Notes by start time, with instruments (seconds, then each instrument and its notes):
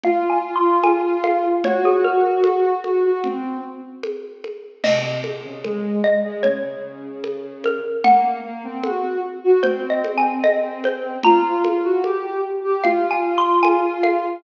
0.04 ocarina F4, xylophone F5, low conga
0.30 xylophone G#5
0.56 xylophone C6
0.83 xylophone G#5, high conga
1.24 xylophone F5, high conga
1.64 ocarina F#4, xylophone C#5, low conga
1.85 xylophone G#4
2.04 xylophone A#4
2.44 high conga
2.84 ocarina F#4, high conga
3.04 ocarina F#4
3.24 ocarina C4, low conga
4.03 high conga
4.44 high conga
4.84 ocarina C3, xylophone D#5, crash, low conga
5.24 ocarina C3, high conga
5.44 ocarina C#3
5.64 ocarina G#3, high conga
6.04 xylophone D#5
6.24 ocarina G#3
6.43 ocarina C#3, xylophone C#5, low conga
7.24 high conga
7.64 xylophone A#4, high conga
8.04 ocarina A#3, xylophone F#5, low conga
8.44 ocarina A#3
8.64 ocarina C4
8.84 ocarina F#4, high conga
9.44 ocarina F#4
9.63 ocarina C4, xylophone C5, low conga
9.90 xylophone D#5
10.04 high conga
10.18 xylophone G#5
10.44 xylophone D#5, high conga
10.84 xylophone C5, high conga
11.23 ocarina F4, xylophone A#5, low conga
11.64 ocarina F4, high conga
11.84 ocarina F#4
12.04 ocarina G4, high conga
12.64 ocarina G4
12.84 ocarina F4, xylophone F5, low conga
13.11 xylophone G#5
13.38 xylophone C6
13.63 xylophone G#5, high conga
14.03 xylophone F5, high conga